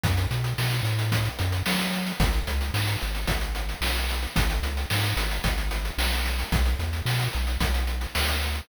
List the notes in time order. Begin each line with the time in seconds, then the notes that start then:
0.03 F#2, kick, closed hi-hat
0.17 closed hi-hat
0.31 B2, closed hi-hat
0.44 closed hi-hat
0.58 B2, snare
0.71 closed hi-hat
0.83 A2, closed hi-hat
0.99 closed hi-hat
1.12 kick, closed hi-hat
1.25 closed hi-hat
1.39 F#2, closed hi-hat
1.52 closed hi-hat
1.66 F#3, snare
1.79 closed hi-hat
1.93 closed hi-hat
2.06 closed hi-hat
2.20 G#1, kick, closed hi-hat
2.33 closed hi-hat
2.47 C#2, closed hi-hat
2.61 closed hi-hat
2.74 G#2, snare
2.87 closed hi-hat
3.01 G#1, closed hi-hat
3.15 closed hi-hat
3.27 G#1, kick, closed hi-hat
3.41 closed hi-hat
3.55 closed hi-hat
3.69 closed hi-hat
3.81 B1, snare
3.96 closed hi-hat
4.09 closed hi-hat
4.23 closed hi-hat
4.36 G#1, kick, closed hi-hat
4.50 closed hi-hat
4.63 C#2, closed hi-hat
4.77 closed hi-hat
4.90 G#2, snare
5.03 closed hi-hat
5.16 G#1, closed hi-hat
5.31 closed hi-hat
5.44 G#1, kick, closed hi-hat
5.58 closed hi-hat
5.71 closed hi-hat
5.85 closed hi-hat
5.98 B1, snare
6.12 closed hi-hat
6.26 closed hi-hat
6.39 closed hi-hat
6.52 B1, kick, closed hi-hat
6.65 closed hi-hat
6.79 E2, closed hi-hat
6.93 closed hi-hat
7.05 B2, snare
7.20 closed hi-hat
7.33 B1, closed hi-hat
7.47 closed hi-hat
7.60 B1, kick, closed hi-hat
7.74 closed hi-hat
7.87 closed hi-hat
8.01 closed hi-hat
8.15 D2, snare
8.28 closed hi-hat
8.42 closed hi-hat
8.55 closed hi-hat